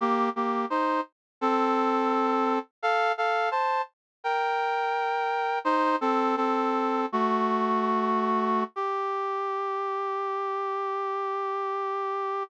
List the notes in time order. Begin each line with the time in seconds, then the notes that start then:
0.01 A#3 G4
0.36 A#3 G4
0.70 D#4 C5
1.41 C4 A4
2.82 A4 F5
3.18 A4 F5
3.51 C5 A5
4.24 A#4 G5
5.65 D#4 C5
6.01 C4 A4
6.37 C4 A4
7.12 A3 F#4
8.76 G4